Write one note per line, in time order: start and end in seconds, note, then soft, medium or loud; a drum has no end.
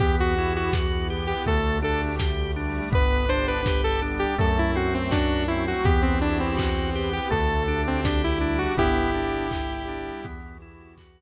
0.00 1.34 E2 loud
0.00 0.73 B3 medium
0.00 0.34 B3 medium
0.00 0.73 E4 medium
0.00 0.73 F#4 medium
0.00 0.16 G4 loud
0.00 0.73 G4 loud
0.00 kick loud
0.00 crash loud
0.20 0.53 F#4 medium
0.37 0.71 E4 medium
0.37 open hi-hat loud
0.56 0.74 F#4 medium
0.73 1.46 B3 loud
0.73 1.46 E4 medium
0.73 1.07 F#4 medium
0.73 1.46 G4 medium
0.73 1.46 B4 medium
0.73 kick loud
0.73 snare loud
1.10 1.43 G4 medium
1.10 open hi-hat medium
1.27 1.45 G4 medium
1.46 2.81 D2 loud
1.46 2.18 A3 medium
1.46 1.80 A3 loud
1.46 2.18 D4 medium
1.46 2.18 G4 medium
1.46 1.78 A4 medium
1.46 kick loud
1.46 closed hi-hat loud
1.82 2.15 D4 medium
1.82 2.01 A4 medium
1.82 open hi-hat medium
2.19 2.92 G3 medium
2.19 2.92 A3 medium
2.19 2.52 G4 medium
2.19 2.92 G4 medium
2.19 kick loud
2.19 snare loud
2.56 2.89 D4 medium
2.56 open hi-hat loud
2.91 4.26 G1 loud
2.91 3.25 B3 medium
2.91 3.65 B3 medium
2.91 3.65 D4 medium
2.91 3.65 G4 medium
2.91 3.30 B4 loud
2.91 kick loud
2.91 closed hi-hat loud
3.29 3.62 D4 medium
3.29 3.46 C5 loud
3.29 open hi-hat loud
3.48 3.81 B4 medium
3.66 4.38 G3 medium
3.66 4.38 B3 medium
3.66 4.38 G4 medium
3.66 4.00 G4 medium
3.66 kick loud
3.66 snare loud
3.84 4.01 A4 loud
4.02 4.35 D4 medium
4.02 open hi-hat loud
4.19 4.37 G4 medium
4.38 5.73 F#2 loud
4.38 4.71 A3 loud
4.38 5.12 A3 loud
4.38 5.12 C4 medium
4.38 5.12 F#4 medium
4.38 4.58 A4 medium
4.38 kick loud
4.38 closed hi-hat loud
4.59 4.76 E4 medium
4.75 5.08 C4 medium
4.75 4.94 F#4 medium
4.75 open hi-hat loud
4.94 5.12 C4 medium
5.11 5.85 F#3 medium
5.11 5.85 A3 medium
5.11 5.46 D4 medium
5.11 5.44 F#4 medium
5.11 5.85 F#4 loud
5.11 kick loud
5.11 snare loud
5.48 5.83 C4 medium
5.48 5.65 E4 medium
5.48 open hi-hat loud
5.68 5.85 F#4 medium
5.85 7.19 E2 loud
5.85 6.58 B3 medium
5.85 6.18 B3 loud
5.85 6.58 E4 loud
5.85 6.58 F#4 medium
5.85 6.02 G4 medium
5.85 6.58 G4 loud
5.85 kick loud
5.85 closed hi-hat loud
6.02 6.20 C4 medium
6.21 6.39 D4 medium
6.21 6.55 E4 medium
6.21 open hi-hat loud
6.40 7.09 C4 medium
6.57 7.31 B3 medium
6.57 7.31 E4 medium
6.57 6.90 F#4 medium
6.57 7.31 G4 medium
6.57 7.31 B4 loud
6.57 kick loud
6.57 clap loud
6.95 7.28 G4 medium
6.95 open hi-hat loud
7.13 7.30 G4 medium
7.30 8.66 D2 loud
7.30 7.63 A3 loud
7.30 8.04 A3 medium
7.30 8.04 D4 medium
7.30 8.04 G4 medium
7.30 7.82 A4 medium
7.30 kick loud
7.30 closed hi-hat loud
7.68 8.01 D4 medium
7.68 open hi-hat medium
7.87 8.05 C4 medium
8.04 8.77 G3 medium
8.04 8.77 A3 medium
8.04 8.22 D4 medium
8.04 8.77 G4 loud
8.04 8.39 G4 medium
8.04 kick loud
8.04 snare loud
8.24 8.58 E4 medium
8.41 8.74 D4 medium
8.41 open hi-hat loud
8.58 8.76 F#4 medium
8.77 10.12 G1 loud
8.77 9.11 B3 loud
8.77 9.50 B3 loud
8.77 9.50 D4 medium
8.77 10.26 E4 medium
8.77 9.50 G4 loud
8.77 10.26 G4 loud
8.77 kick loud
8.77 closed hi-hat loud
9.14 9.47 D4 medium
9.14 open hi-hat loud
9.51 10.24 G3 loud
9.51 10.24 B3 medium
9.51 10.24 G4 medium
9.51 9.84 G4 medium
9.51 kick loud
9.51 clap loud
9.88 10.21 D4 medium
9.88 open hi-hat loud
10.24 11.21 E2 loud
10.24 10.97 B3 medium
10.24 10.57 B3 loud
10.24 10.97 E4 medium
10.24 10.97 F#4 medium
10.24 10.97 G4 medium
10.24 kick loud
10.24 closed hi-hat loud
10.61 10.95 E4 medium
10.61 open hi-hat loud
10.97 11.21 B3 loud
10.97 11.21 E4 loud
10.97 11.21 F#4 medium
10.97 11.21 G4 medium
10.97 11.21 B4 loud
10.97 kick medium
10.97 clap loud